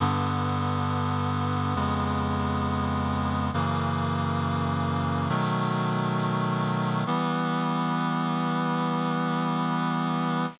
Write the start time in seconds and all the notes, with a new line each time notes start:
0.00 G2 D3 B3
1.75 F2 C#3 G#3 B3
3.53 F#2 C#3 E3 A#3
5.29 B2 D#3 F#3 A3
7.06 E3 G3 B3